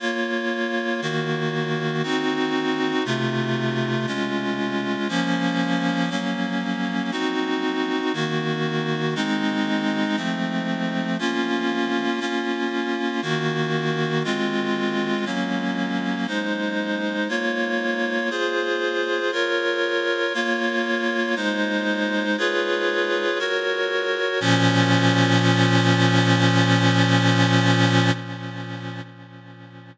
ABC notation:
X:1
M:4/4
L:1/8
Q:1/4=59
K:Bbm
V:1 name="Clarinet"
[B,Fd]2 [E,B,G]2 [CEG]2 [C,=A,F]2 | [A,DF]2 [F,B,D]2 [G,B,D]2 [CEG]2 | [E,B,G]2 [A,CE]2 [F,=A,C]2 [B,DF]2 | [B,DF]2 [E,B,G]2 [A,CF]2 [G,B,D]2 |
[A,Ec]2 [B,Fd]2 [FAc]2 [FBd]2 | [B,Fd]2 [A,Ec]2 [FA_cd]2 [GBd]2 | [B,,F,D]8 |]